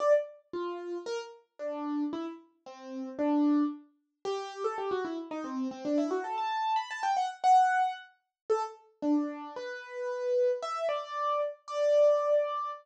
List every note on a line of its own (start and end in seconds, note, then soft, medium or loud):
0.00 0.13 D5 loud
0.53 0.98 F4 medium
1.06 1.19 A#4 loud
1.59 2.04 D4 medium
2.13 2.25 E4 loud
2.66 3.09 C4 medium
3.19 3.63 D4 loud
4.25 4.63 G4 loud
4.64 4.77 A4 loud
4.78 4.91 G4 medium
4.91 5.04 F#4 medium
5.05 5.17 E4 medium
5.31 5.44 D#4 loud
5.44 5.68 C4 medium
5.71 5.84 C4 loud
5.85 5.97 D4 loud
5.98 6.10 E4 loud
6.11 6.23 F#4 medium
6.24 6.37 A4 medium
6.38 6.77 A5 loud
6.76 6.89 B5 loud
6.91 7.03 A5 loud
7.03 7.16 G5 loud
7.17 7.29 F#5 medium
7.44 7.93 F#5 loud
8.50 8.62 A4 loud
9.02 9.53 D4 medium
9.56 10.51 B4 loud
10.62 10.87 E5 loud
10.89 11.41 D5 loud
11.68 12.71 D5 loud